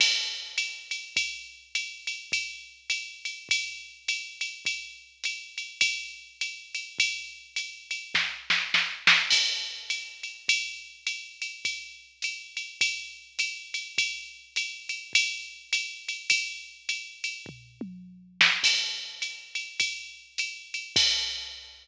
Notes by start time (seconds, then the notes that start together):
0.00 kick, crash, ride
0.58 hi-hat pedal, ride
0.91 ride
1.16 kick, ride
1.75 hi-hat pedal, ride
2.07 ride
2.32 kick, ride
2.90 hi-hat pedal, ride
3.25 ride
3.49 kick, ride
4.08 hi-hat pedal, ride
4.41 ride
4.65 kick, ride
5.24 hi-hat pedal, ride
5.58 ride
5.81 kick, ride
6.41 hi-hat pedal, ride
6.75 ride
6.99 kick, ride
7.56 hi-hat pedal, ride
7.91 ride
8.14 kick, snare
8.50 snare
8.74 snare
9.07 snare
9.30 kick, crash, ride
9.90 hi-hat pedal, ride
10.23 ride
10.48 kick, ride
11.07 hi-hat pedal, ride
11.42 ride
11.65 kick, ride
12.22 hi-hat pedal, ride
12.57 ride
12.81 kick, ride
13.39 hi-hat pedal, ride
13.74 ride
13.98 kick, ride
14.56 hi-hat pedal, ride
14.89 ride
15.13 kick, ride
15.73 hi-hat pedal, ride
16.08 ride
16.30 kick, ride
16.89 hi-hat pedal, ride
17.24 ride
17.46 kick, floor tom
17.81 mid tom
18.41 snare
18.63 kick, crash, ride
19.22 hi-hat pedal, ride
19.55 ride
19.80 kick, ride
20.38 hi-hat pedal, ride
20.74 ride
20.96 kick, crash